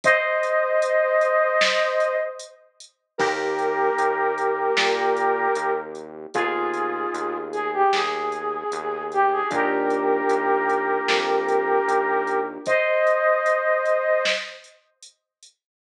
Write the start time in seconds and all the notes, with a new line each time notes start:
0.04 C5 D#5, kick, closed hi-hat
0.43 closed hi-hat
0.82 closed hi-hat
1.21 closed hi-hat
1.61 snare
2.00 closed hi-hat
2.39 closed hi-hat
2.80 closed hi-hat
3.18 D#2 A#3 D#4 G4 A#4, kick, crash
3.59 closed hi-hat
3.98 D#2, closed hi-hat
4.38 closed hi-hat
4.77 A#2, snare
5.16 closed hi-hat
5.55 D#2, closed hi-hat
5.95 closed hi-hat
6.34 D#2 B3 D#4 F4 G#4, kick, closed hi-hat
6.74 closed hi-hat
7.14 D#2, closed hi-hat
7.52 G#4, closed hi-hat
7.74 G4
7.93 D#2 G#4, snare
8.32 closed hi-hat
8.72 D#2, closed hi-hat
9.12 G4, closed hi-hat
9.32 G#4
9.50 D#2 A#3 D4 F4 G4 A#4, kick, closed hi-hat
9.90 closed hi-hat
10.29 D#2, closed hi-hat
10.69 closed hi-hat
11.08 F2, snare
11.48 closed hi-hat
11.88 D#2, closed hi-hat
12.27 closed hi-hat
12.66 C5 D#5, kick, closed hi-hat
13.07 closed hi-hat
13.46 closed hi-hat
13.85 closed hi-hat
14.25 snare
14.64 closed hi-hat
15.02 closed hi-hat
15.43 closed hi-hat